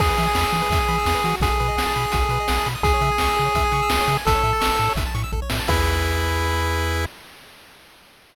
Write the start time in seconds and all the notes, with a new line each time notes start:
0.00 E2 G#4, kick, crash
0.09 B4
0.17 E3 E5, closed hi-hat
0.27 G#5
0.35 E2 B5, snare
0.43 E6
0.53 E3 G#4, closed hi-hat
0.62 B4
0.70 E2 E5, kick, closed hi-hat
0.80 G#5
0.88 E3 B5, closed hi-hat
0.98 E6
1.06 E2 G#4, snare
1.15 B4
1.24 E3 F#4, closed hi-hat
1.40 B1 G#4, kick, closed hi-hat
1.50 A4
1.60 B2 B4, closed hi-hat
1.68 D#5
1.77 B1 F#5, snare
1.86 A5
1.96 B2 B5, closed hi-hat
2.04 D#6
2.12 B1 F#4, kick, closed hi-hat
2.22 A4
2.29 B2 B4, closed hi-hat
2.40 D#5
2.48 B1 F#5, snare
2.58 A5
2.66 B2 B5, closed hi-hat
2.75 D#6
2.83 C#2 G#4, kick, closed hi-hat
2.94 C#5
3.01 C#3 E5, closed hi-hat
3.12 G#5
3.18 C#2 C#6, snare
3.29 E6
3.36 C#3 G#4, closed hi-hat
3.45 C#5
3.55 C#2 E5, kick, closed hi-hat
3.65 G#5
3.72 C#3 C#6, closed hi-hat
3.82 E6
3.89 C#2 G#4, snare
4.01 C#5
4.08 C#3 E5, closed hi-hat
4.17 G#5
4.25 A1 A4, kick, closed hi-hat
4.35 C#5
4.43 A2 E5, closed hi-hat
4.53 A5
4.60 A1 C#6, snare
4.71 E6
4.78 A2 A4, closed hi-hat
4.89 C#5
4.95 A1 E5, kick, closed hi-hat
5.06 A5
5.14 A2 C#6, closed hi-hat
5.24 E6
5.32 A1 A4, kick
5.42 C#5
5.49 A2 E5, snare
5.59 A5
5.67 E2 E4 G#4 B4 E5, kick, crash